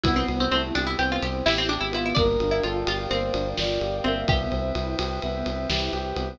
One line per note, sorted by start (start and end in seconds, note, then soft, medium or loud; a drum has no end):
0.04 0.24 C2 medium
0.04 2.14 B3 medium
0.04 0.27 B3 loud
0.04 0.47 B3 loud
0.04 2.14 C4 medium
0.04 0.15 E4 loud
0.04 2.14 E4 medium
0.04 2.14 G4 medium
0.04 kick medium
0.04 ride loud
0.16 0.27 C4 loud
0.28 0.48 C2 medium
0.28 0.49 C4 medium
0.28 ride medium
0.40 0.51 C4 loud
0.51 0.71 C2 medium
0.51 0.73 A3 loud
0.51 0.63 C4 medium
0.51 0.74 E4 medium
0.51 ride medium
0.75 0.95 C2 medium
0.75 0.86 D4 loud
0.75 0.96 G4 loud
0.75 ride medium
0.87 0.98 E4 loud
0.98 1.19 C2 medium
0.98 1.20 B3 loud
0.98 1.45 C4 loud
0.98 1.10 G4 medium
0.98 ride medium
1.12 1.23 F4 loud
1.22 1.42 C2 medium
1.22 1.45 C4 medium
1.22 1.34 G4 loud
1.22 ride medium
1.46 1.78 A1 medium
1.46 1.57 E4 loud
1.46 1.68 E4 medium
1.46 1.90 G4 loud
1.46 snare loud
1.58 1.69 C4 loud
1.69 1.80 D4 medium
1.69 1.92 G4 loud
1.69 ride medium
1.81 2.13 G#1 medium
1.81 1.92 E4 medium
1.92 2.13 B3 loud
1.92 2.05 E4 loud
1.92 2.13 F4 loud
1.92 ride medium
2.06 2.17 E4 medium
2.15 2.37 G1 medium
2.15 2.37 A#3 loud
2.15 2.43 D4 loud
2.15 4.26 A#4 medium
2.15 2.62 A#4 loud
2.15 4.26 D5 medium
2.15 4.26 F5 medium
2.15 4.26 G5 medium
2.15 kick medium
2.15 ride medium
2.40 2.60 G1 medium
2.40 2.63 D4 medium
2.40 ride medium
2.51 2.62 E4 medium
2.63 2.84 G1 medium
2.63 2.85 F4 medium
2.63 2.86 F4 medium
2.63 2.85 A4 loud
2.63 ride medium
2.86 3.07 G1 medium
2.86 3.10 F4 loud
2.86 3.08 G4 medium
2.86 ride loud
3.09 3.31 G1 medium
3.09 3.33 A#3 loud
3.09 3.33 C4 loud
3.09 3.49 C5 loud
3.09 ride medium
3.33 3.54 G1 medium
3.33 3.54 D4 medium
3.33 ride medium
3.57 3.79 G1 medium
3.57 3.78 F4 medium
3.57 3.97 D5 loud
3.57 snare loud
3.80 4.01 G1 medium
3.80 4.01 G4 medium
3.80 ride medium
4.04 4.25 G1 medium
4.04 4.27 A#3 loud
4.04 4.26 C4 medium
4.04 4.27 E5 loud
4.04 ride medium
4.28 4.48 C2 medium
4.28 4.50 B3 loud
4.28 5.85 G4 loud
4.28 6.38 B4 medium
4.28 6.38 C5 medium
4.28 6.38 E5 medium
4.28 4.74 E5 loud
4.28 6.38 G5 medium
4.28 kick loud
4.28 ride medium
4.51 4.72 C2 medium
4.51 4.72 C4 loud
4.51 ride medium
4.75 4.95 C2 medium
4.75 4.96 E4 medium
4.75 ride medium
4.99 5.19 C2 medium
4.99 5.20 G4 medium
4.99 ride loud
5.22 5.43 C2 medium
5.22 5.44 B3 loud
5.22 5.69 E5 medium
5.22 ride medium
5.46 5.66 C2 medium
5.46 5.68 C4 medium
5.46 ride medium
5.70 5.90 C2 medium
5.70 5.91 E4 medium
5.70 6.29 G4 loud
5.70 snare loud
5.93 6.13 C2 medium
5.93 6.15 G4 medium
5.93 ride medium
6.16 6.36 C2 medium
6.16 6.37 B3 loud
6.16 ride medium